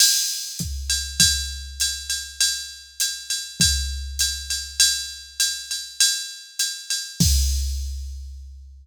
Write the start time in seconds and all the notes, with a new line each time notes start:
0.00 crash, ride
0.59 kick, hi-hat pedal
0.90 ride
1.20 kick, ride
1.80 hi-hat pedal, ride
2.10 ride
2.41 ride
3.00 hi-hat pedal, ride
3.30 ride
3.60 kick, ride
4.19 hi-hat pedal, ride
4.50 ride
4.80 ride
5.40 hi-hat pedal, ride
5.71 ride
6.00 ride
6.59 hi-hat pedal, ride
6.90 ride
7.20 kick, crash